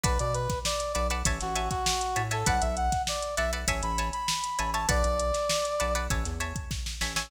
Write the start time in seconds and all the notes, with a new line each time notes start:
0.04 B1 B4 D5 F#5 A5, kick, closed hi-hat
0.19 B2 D5, closed hi-hat
0.34 B4, closed hi-hat
0.49 kick, snare, closed hi-hat
0.65 D5, snare
0.80 closed hi-hat
0.93 B1 B4 D5 F#5 A5, closed hi-hat
1.10 B4 D5 F#5 A5, closed hi-hat
1.25 A1 C#5 E5 G#5 A5, kick, closed hi-hat
1.41 A1 F#4, snare, closed hi-hat
1.55 C#5 E5 G#5 A5, closed hi-hat
1.70 F#4, kick, snare, closed hi-hat
1.86 snare
2.01 closed hi-hat
2.16 A2 C#5 E5 G#5 A5, closed hi-hat
2.31 A4 C#5 E5 G#5 A5, closed hi-hat
2.46 B1 B4 D5 F#5 A5, kick, closed hi-hat
2.61 B1 E5, closed hi-hat
2.77 F#5, closed hi-hat
2.92 kick, snare, closed hi-hat
3.07 D5, snare
3.22 closed hi-hat
3.37 B1 B4 D5 E5 F#5 A5, snare, closed hi-hat
3.53 B4 D5 F#5 A5, closed hi-hat
3.68 A1 C#5 E5 G#5 A5, kick, closed hi-hat
3.83 A1 B5, closed hi-hat
3.98 C#5 E5 G#5 A5, closed hi-hat
4.13 B5, closed hi-hat
4.28 snare
4.44 closed hi-hat
4.59 A1 C#5 E5 G#5 A5, closed hi-hat
4.73 C#5 E5 G#5 A5, closed hi-hat
4.89 B1 B4 D5 F#5 A5, kick, closed hi-hat
5.04 B1, closed hi-hat
5.20 closed hi-hat
5.34 snare, closed hi-hat
5.49 snare
5.65 closed hi-hat
5.80 B1 B4 D5 F#5 A5, closed hi-hat
5.95 B4 D5 F#5 A5, closed hi-hat
6.10 A1 C#5 E5 G#5 A5, kick, closed hi-hat
6.25 E2, snare, closed hi-hat
6.40 C#5 E5 G#5 A5, closed hi-hat
6.56 kick, closed hi-hat
6.71 kick, snare
6.86 snare
7.01 A1 C#5 E5 G#5 A5, snare
7.16 C#5 E5 G#5 A5, snare